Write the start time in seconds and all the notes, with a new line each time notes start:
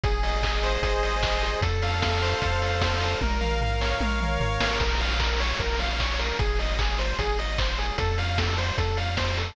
0.04 G#1 G#4, kick, closed hi-hat
0.23 D#5, open hi-hat
0.43 G#4, kick, clap
0.63 C5, open hi-hat
0.82 G#1 G#4, kick, closed hi-hat
1.03 D#5, open hi-hat
1.23 C5, kick, clap
1.43 G#4, open hi-hat
1.61 F2 A4, kick, closed hi-hat
1.82 F5, open hi-hat
2.02 A4, kick, snare
2.22 C5, open hi-hat
2.42 F2 A4, kick, closed hi-hat
2.62 F5, open hi-hat
2.81 C5, kick, snare
3.01 A4, open hi-hat
3.21 A#1 A#4, kick, high tom
3.41 F5, mid tom
3.61 A#4, floor tom
3.81 C#5, snare
4.00 A#1 A#4, high tom
4.20 F5, mid tom
4.40 G#1 C#5, floor tom
4.60 A1 A#4, snare
4.80 A#1 A#4, kick, crash
5.00 F5, open hi-hat
5.20 A#4, kick, clap
5.40 C#5, open hi-hat
5.59 A#1 A#4, kick, closed hi-hat
5.79 F5, open hi-hat
6.00 C#5, kick, clap
6.19 A#4, open hi-hat
6.39 G#1 G#4, kick, closed hi-hat
6.59 D#5, open hi-hat
6.79 G#4, kick, clap
6.98 C5, open hi-hat
7.19 G#1 G#4, kick, closed hi-hat
7.39 D#5, open hi-hat
7.58 C5, kick, clap
7.78 G#4, open hi-hat
7.98 F2 A4, kick, closed hi-hat
8.18 F5, open hi-hat
8.38 A4, kick, snare
8.58 C5, open hi-hat
8.78 F2 A4, kick, closed hi-hat
8.97 F5, open hi-hat
9.17 C5, kick, snare
9.38 A4, open hi-hat